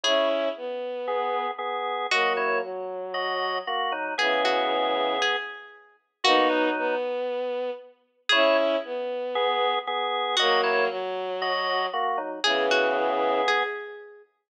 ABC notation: X:1
M:4/4
L:1/8
Q:"Swing 16ths" 1/4=116
K:Bmix
V:1 name="Pizzicato Strings"
G3 z5 | F2 z6 | G F3 G3 z | F8 |
G3 z5 | F2 z6 | G F3 G3 z |]
V:2 name="Drawbar Organ"
[Ec] z3 [B,G]2 [B,G]2 | [Fd] [Ec] z2 [Fd]2 [^A,F] [F,D] | [B,G]5 z3 | [^A,F] [F,D]2 z5 |
[Ec] z3 [B,G]2 [B,G]2 | [Fd] [Ec] z2 [Fd]2 [^A,F] [F,D] | [B,G]5 z3 |]
V:3 name="Violin"
[CE]2 B,4 z2 | [F,^A,]2 F,4 z2 | [C,E,]4 z4 | [B,D]2 B,4 z2 |
[CE]2 B,4 z2 | [F,^A,]2 F,4 z2 | [C,E,]4 z4 |]